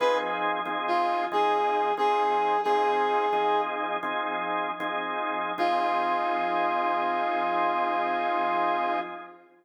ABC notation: X:1
M:12/8
L:1/8
Q:3/8=91
K:Fm
V:1 name="Brass Section"
=B z3 F2 A3 A3 | "^rit." A5 z7 | F12 |]
V:2 name="Drawbar Organ"
[F,CEA]3 [F,CEA]3 [F,CEA]3 [F,CEA]3 | "^rit." [F,CEA]3 [F,CEA]3 [F,CEA]3 [F,CEA]3 | [F,CEA]12 |]